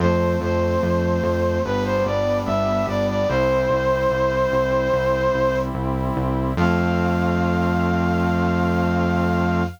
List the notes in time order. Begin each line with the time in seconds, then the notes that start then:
0.00 F2 F3 A3 C4 C5
0.41 F2 C5
0.83 F2
1.23 F2
1.65 G1 G3 B3 D4 B4
1.85 C5
2.05 G1 D5
2.46 G1 E5
2.87 G1 D5
3.09 D5
3.29 C2 G3 C4 E4 C5
3.70 C2
4.10 C2
4.52 C2
4.93 C2
5.34 C2
5.74 C2
6.17 C2
6.57 F2 F3 A3 C4 F5